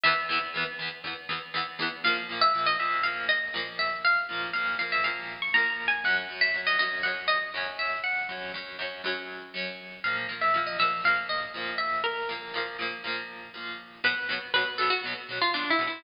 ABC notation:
X:1
M:4/4
L:1/16
Q:1/4=120
K:Bm
V:1 name="Acoustic Guitar (steel)"
e8 z8 | [K:Bbm] f z2 _f2 e =e2 =f2 _e4 =e2 | f4 f2 f =e f3 d' (3b2 b2 a2 | g z2 _f2 e e2 g2 e4 =e2 |
g10 z6 | f z2 _f2 e =e2 =f2 _e4 =e2 | B10 z6 | [K:Bm] B4 B2 A F z3 =F (3D2 E2 E2 |]
V:2 name="Acoustic Guitar (steel)"
[E,,E,B,]2 [E,,E,B,]2 [E,,E,B,]2 [E,,E,B,]2 [E,,E,B,]2 [E,,E,B,]2 [E,,E,B,]2 [E,,E,B,]2 | [K:Bbm] [B,,F,B,]2 [B,,F,B,]2 [B,,F,B,]2 [B,,F,B,]2 [B,,F,B,]4 [B,,F,B,]4- | [B,,F,B,]2 [B,,F,B,]2 [B,,F,B,]2 [B,,F,B,]2 [B,,F,B,]4 [B,,F,B,]4 | [G,,G,D]2 [G,,G,D]2 [G,,G,D]2 [G,,G,D]2 [G,,G,D]4 [G,,G,D]4- |
[G,,G,D]2 [G,,G,D]2 [G,,G,D]2 [G,,G,D]2 [G,,G,D]4 [G,,G,D]4 | [B,,F,B,]2 [B,,F,B,]2 [B,,F,B,]2 [B,,F,B,]2 [B,,F,B,]4 [B,,F,B,]4- | [B,,F,B,]2 [B,,F,B,]2 [B,,F,B,]2 [B,,F,B,]2 [B,,F,B,]4 [B,,F,B,]4 | [K:Bm] [B,,F,B,]2 [B,,F,B,]2 [B,,F,B,]2 [B,,F,B,]2 [B,,F,B,]2 [B,,F,B,]2 [B,,F,B,]2 [B,,F,B,]2 |]